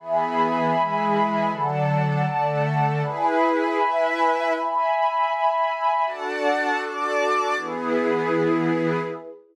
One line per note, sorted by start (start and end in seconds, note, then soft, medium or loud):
0.00 0.75 E3 loud
0.00 0.75 B3 loud
0.00 0.75 G#4 medium
0.00 1.50 E5 medium
0.00 1.50 G#5 medium
0.00 1.50 B5 medium
0.76 1.51 E3 loud
0.76 1.51 G#3 loud
0.76 1.51 G#4 medium
1.50 2.26 D3 loud
1.50 2.26 F#3 loud
1.50 2.26 A4 medium
1.50 3.00 D5 medium
1.50 3.00 F#5 medium
1.50 3.00 A5 medium
2.27 3.02 D3 medium
2.27 3.02 A3 medium
2.27 3.02 A4 medium
3.03 3.77 E4 loud
3.03 3.78 G#4 loud
3.03 3.77 B4 loud
3.03 4.53 E5 medium
3.03 4.53 G#5 medium
3.03 4.53 B5 medium
3.78 4.53 E4 medium
3.78 4.53 B4 loud
3.78 4.53 E5 loud
4.53 6.03 E5 medium
4.53 6.03 G#5 medium
4.53 6.03 B5 medium
6.05 7.56 D4 medium
6.05 7.56 F#4 medium
6.05 7.56 A4 medium
6.05 6.80 D5 loud
6.05 6.80 F#5 loud
6.05 6.80 A5 loud
6.81 7.56 D5 loud
6.81 7.56 A5 medium
6.81 7.56 D6 loud
7.56 9.00 E3 loud
7.56 9.00 B3 loud
7.56 9.01 E4 loud
7.56 9.00 G#4 medium
7.56 9.01 G#4 medium
7.56 9.01 B4 medium